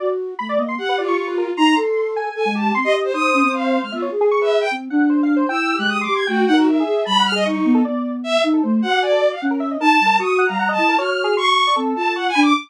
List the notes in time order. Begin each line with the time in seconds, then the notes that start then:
0.00 F#4 D5
0.39 A3 B5
0.49 D5
0.58 A#3 D#5
0.68 C6
0.78 G4 F#5
0.89 B4
0.98 F4 D5
1.08 C#6
1.17 C#6
1.27 B4
1.38 A#4
1.57 D#4 A#5 C6
1.76 A4
2.16 G#5
2.35 A4 G#5
2.45 G#3
2.55 G4 A5
2.75 C4 C6
2.84 G4 D#5
2.94 D#5
3.04 C5
3.13 D#4 C5 D#6
3.34 C#4
3.43 C4
3.53 F5
3.82 G#3 F6
3.92 B3 F4 E5
4.02 C#5
4.11 G#4
4.21 G#4
4.31 C#6
4.41 B4 E5
4.61 G5
4.71 C4
4.90 D4 F#5
5.10 C5
5.23 F5
5.36 C5
5.49 E4 G5 E6
5.75 G4 F#6
5.79 G#3
5.88 D#6
6.01 C6 D6
6.08 G4
6.14 G#6
6.27 A3 F#4 G5
6.47 D#4 F#5
6.53 F#4 A#4
6.67 E5
6.80 G#4
6.87 G#4
7.05 G3 A5 B5
7.19 F#5
7.25 F6
7.32 G#4 D#5
7.45 D#4 C#6
7.65 B3
7.74 A4
7.85 B3 D5
8.24 E5
8.43 D#4 E5
8.53 A4
8.63 A3 C5
8.82 F#4 F#5
8.92 G4
9.02 D5 G#5
9.12 A4
9.21 D5
9.31 F5
9.42 C#4 F#5
9.51 A#4
9.60 E5
9.71 D#5
9.80 D#4 A#4 A5
9.93 A5
10.00 G3
10.06 A#4
10.19 F#4 C#6 D#6
10.38 F#5
10.46 G3 F5 A#5
10.59 F#5
10.69 D#5 A5
10.78 E4
10.88 A#4
10.98 F#4 C#5 F6
11.11 C#5
11.24 G#4
11.37 C6 C#6
11.67 D5
11.76 C4 A4
11.96 F4 A5
12.15 F#5 C#6
12.29 G#5
12.35 D4 B5
12.42 D6